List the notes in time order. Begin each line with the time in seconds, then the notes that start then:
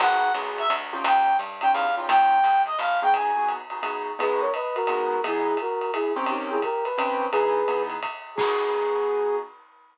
0.00 G#1 B3 D#4 F#4 G#4 F#5, crash, ride
0.34 B1 B3 D#4 F#4 G#4, hi-hat pedal, ride
0.58 E5, ride
0.70 D2, ride
0.93 C#4 D#4 F4 G4
1.04 D#2 G5, ride
1.38 G2, hi-hat pedal, ride
1.61 C#4 D#4 F4 G4 G5, ride
1.73 E2 F5, ride
1.97 C#4 D#4 F4 G4
2.09 D#2 G5, kick, ride
2.44 C#2, hi-hat pedal, ride
2.66 D#5, ride
2.79 G1 F5, ride
3.02 B3 D#4 F#4 G#4 G5
3.14 G#5, kick, ride
3.36 B3 D#4 F#4 G#4
3.49 hi-hat pedal, ride
3.70 B3 D#4 F#4 G#4, ride
3.83 B3 D#4 F#4 G#4, ride
4.19 G#3 B3 D#4 F#4 G#4 B4, ride
4.41 A#4 C#5
4.54 B4 D#5, hi-hat pedal, ride
4.75 F#4 A#4, ride
4.87 G#3 B3 D#4 F#4, ride
5.24 E3 B3 D#4 E4 G#4, ride
5.57 F#4 A#4, hi-hat pedal, ride
5.81 ride
5.94 E4 G#4, ride
6.16 D#3 C4 C#4 G4
6.26 D#4 G4, ride
6.51 E4 G#4
6.62 G4 A#4, kick, hi-hat pedal, ride
6.84 B4, ride
6.98 D#3 C4 C#4 G4, ride
7.32 E3 B3 D#4 G#4 B4, ride
7.66 E3 B3 D#4 G#4, hi-hat pedal, ride
7.90 ride
8.03 kick, ride
8.35 B3 D#4 F#4 G#4, kick, crash